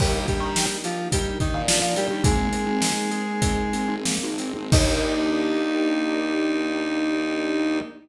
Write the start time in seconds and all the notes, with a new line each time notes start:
0.00 D#2 G3 A#3 D4 D#4 G4, kick, crash
0.28 G3 D4 G4, kick, closed hi-hat
0.40 D#3
0.56 D#4, snare
0.84 F3 F4 G4, closed hi-hat
1.12 G3 D#4 G4, kick, closed hi-hat
1.40 D#3 D4 D#4, kick, closed hi-hat
1.54 A#2
1.67 F3 A#3 F4, snare
1.82 A#2
1.95 G3 D4 G4, closed hi-hat
2.10 D#2
2.24 G#1 G#3 A#3 C4 D#4 G#4, kick, closed hi-hat
2.53 C4, closed hi-hat
2.66 G#1
2.82 D#4, snare
3.11 G#4, closed hi-hat
3.42 D#4, kick, closed hi-hat
3.73 C4, closed hi-hat
3.88 G#1
4.05 A#3, snare
4.23 G#1
4.38 C4, closed hi-hat
4.56 G#1
4.71 D#2 A#3 D4 D#4 G4, kick, crash